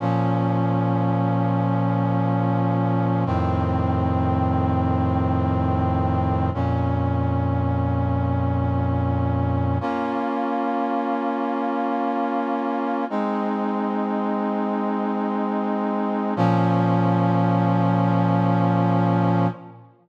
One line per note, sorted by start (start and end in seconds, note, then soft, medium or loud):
0.00 3.24 A#2 medium
0.00 3.24 F3 medium
0.00 3.24 C#4 medium
3.26 6.50 F2 medium
3.26 6.50 A2 medium
3.26 6.50 D#3 medium
3.26 6.50 C4 medium
6.54 9.78 F2 medium
6.54 9.78 A#2 medium
6.54 9.78 C#4 medium
9.81 13.05 A#3 medium
9.81 13.05 C#4 medium
9.81 13.05 F4 medium
13.10 16.34 G#3 medium
13.10 16.34 C4 medium
13.10 16.34 D#4 medium
16.36 19.47 A#2 loud
16.36 19.47 F3 loud
16.36 19.47 C#4 loud